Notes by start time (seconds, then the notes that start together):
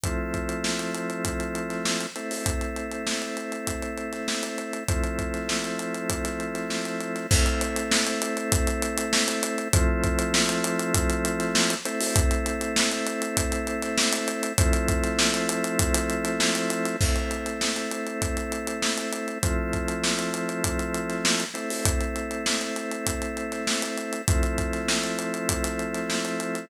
0.03 F3 A3 C4 E4, kick, closed hi-hat
0.34 kick, closed hi-hat
0.49 closed hi-hat
0.64 snare
0.79 closed hi-hat
0.94 closed hi-hat
1.10 closed hi-hat
1.25 kick, closed hi-hat
1.40 closed hi-hat
1.55 closed hi-hat
1.70 snare, closed hi-hat
1.85 snare
2.01 closed hi-hat
2.16 A3 C4 E4, closed hi-hat
2.31 open hi-hat
2.46 kick, closed hi-hat
2.61 closed hi-hat
2.76 closed hi-hat
2.91 closed hi-hat
3.07 snare
3.22 closed hi-hat
3.37 closed hi-hat
3.52 closed hi-hat
3.67 kick, closed hi-hat
3.82 closed hi-hat
3.97 closed hi-hat
4.13 snare, closed hi-hat
4.28 snare
4.43 snare, closed hi-hat
4.58 closed hi-hat
4.73 closed hi-hat
4.88 F3 A3 C4 E4, kick, closed hi-hat
5.04 closed hi-hat
5.19 kick, closed hi-hat
5.34 snare, closed hi-hat
5.49 snare
5.64 closed hi-hat
5.79 closed hi-hat
5.94 closed hi-hat
6.10 kick, closed hi-hat
6.25 snare, closed hi-hat
6.40 closed hi-hat
6.55 snare, closed hi-hat
6.70 snare
6.85 closed hi-hat
7.01 closed hi-hat
7.16 snare, closed hi-hat
7.31 A3 C4 E4, kick, crash
7.46 closed hi-hat
7.61 closed hi-hat
7.76 snare, closed hi-hat
7.91 snare
8.06 snare, closed hi-hat
8.22 closed hi-hat
8.37 closed hi-hat
8.52 kick, closed hi-hat
8.67 closed hi-hat
8.82 closed hi-hat
8.97 closed hi-hat
9.13 snare
9.28 closed hi-hat
9.43 closed hi-hat
9.58 closed hi-hat
9.73 F3 A3 C4 E4, kick, closed hi-hat
10.04 kick, closed hi-hat
10.19 closed hi-hat
10.34 snare
10.49 closed hi-hat
10.64 closed hi-hat
10.79 closed hi-hat
10.94 kick, closed hi-hat
11.10 closed hi-hat
11.25 closed hi-hat
11.40 snare, closed hi-hat
11.55 snare
11.70 closed hi-hat
11.85 A3 C4 E4, closed hi-hat
12.00 open hi-hat
12.16 kick, closed hi-hat
12.31 closed hi-hat
12.46 closed hi-hat
12.61 closed hi-hat
12.76 snare
12.91 closed hi-hat
13.07 closed hi-hat
13.22 closed hi-hat
13.37 kick, closed hi-hat
13.52 closed hi-hat
13.67 closed hi-hat
13.82 snare, closed hi-hat
13.97 snare
14.13 snare, closed hi-hat
14.28 closed hi-hat
14.43 closed hi-hat
14.58 F3 A3 C4 E4, kick, closed hi-hat
14.73 closed hi-hat
14.88 kick, closed hi-hat
15.04 snare, closed hi-hat
15.19 snare
15.34 closed hi-hat
15.49 closed hi-hat
15.64 closed hi-hat
15.79 kick, closed hi-hat
15.94 snare, closed hi-hat
16.10 closed hi-hat
16.25 snare, closed hi-hat
16.40 snare
16.55 closed hi-hat
16.70 closed hi-hat
16.85 snare, closed hi-hat
17.01 A3 C4 E4, kick, crash
17.16 closed hi-hat
17.31 closed hi-hat
17.46 snare, closed hi-hat
17.61 snare
17.76 snare, closed hi-hat
17.91 closed hi-hat
18.07 closed hi-hat
18.22 kick, closed hi-hat
18.37 closed hi-hat
18.52 closed hi-hat
18.67 closed hi-hat
18.82 snare
18.97 closed hi-hat
19.13 closed hi-hat
19.28 closed hi-hat
19.43 F3 A3 C4 E4, kick, closed hi-hat
19.73 kick, closed hi-hat
19.88 closed hi-hat
20.04 snare
20.19 closed hi-hat
20.34 closed hi-hat
20.49 closed hi-hat
20.64 kick, closed hi-hat
20.79 closed hi-hat
20.94 closed hi-hat
21.10 snare, closed hi-hat
21.25 snare
21.40 closed hi-hat
21.54 A3 C4 E4, closed hi-hat
21.70 open hi-hat
21.85 kick, closed hi-hat
22.01 closed hi-hat
22.16 closed hi-hat
22.31 closed hi-hat
22.46 snare
22.61 closed hi-hat
22.76 closed hi-hat
22.91 closed hi-hat
23.06 kick, closed hi-hat
23.22 closed hi-hat
23.37 closed hi-hat
23.52 snare, closed hi-hat
23.67 snare
23.82 snare, closed hi-hat
23.97 closed hi-hat
24.13 closed hi-hat
24.28 F3 A3 C4 E4, kick, closed hi-hat
24.43 closed hi-hat
24.58 kick, closed hi-hat
24.73 snare, closed hi-hat
24.88 snare
25.04 closed hi-hat
25.19 closed hi-hat
25.34 closed hi-hat
25.49 kick, closed hi-hat
25.64 snare, closed hi-hat
25.79 closed hi-hat
25.94 snare, closed hi-hat
26.10 snare
26.25 closed hi-hat
26.40 closed hi-hat
26.55 snare, closed hi-hat